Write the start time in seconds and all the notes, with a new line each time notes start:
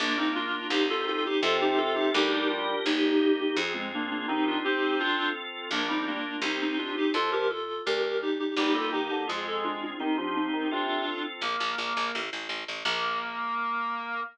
0.00 A#1 A#3 D4 F4
0.18 A#3 C4 D#4
0.35 D4 F4
0.70 C2 C4 D#4 G4
0.90 F4 A4
1.08 F4 A4
1.26 D#4 G4
1.42 F2 C3 C4 F4 A4
1.61 D#4 G4
1.78 F4 A4
1.95 D#4 G4
2.14 D2 G3 D4 D#4 G4 A#4
2.33 D#4 G4
2.50 D4 F4
2.85 G1 A#3 D#4 G4
3.04 D#4
3.40 D#4 G4
3.56 F2 C4 F4 G#4
3.74 G#3 C4
3.94 A#3 D4
4.11 A#3 D4
4.28 D#3 C4 D#4 G4
4.47 D4 F4
4.64 C4 D#4 G4
4.99 C4 D4 F4 A4
5.71 A#1 A#3 D4 F4
5.88 G3 C4 D#4
6.07 A#3 D4
6.42 C2 C4 D#4 G4
6.61 C4 D#4
6.78 D4 F4
6.97 D#4 G4
7.14 F2 F3 F4 A4
7.32 G4 A#4
7.50 F4 A4
7.86 D2 G4 A#4
8.02 G4 A#4
8.22 D#4 G4
8.39 D#4 G4
8.57 G1 G3 A#3 D#4 G4
8.74 G3 F4 A4
8.92 D#3 D#4 G4
9.11 D3
9.27 F2 G#3 C4 F4 G#4
9.47 A4
9.64 D4 F4
9.83 D4 F4
10.00 D#3 C4 D#4 G4
10.17 F3 D4 F4
10.36 C4 D#4
10.53 D#3
10.71 C3 C4 D4 F4 A4
11.41 A#1 A#3
11.60 A#1
11.78 A#1
11.97 A#1
12.15 A1
12.33 A1
12.49 A1
12.68 A1
12.85 A#1 A#3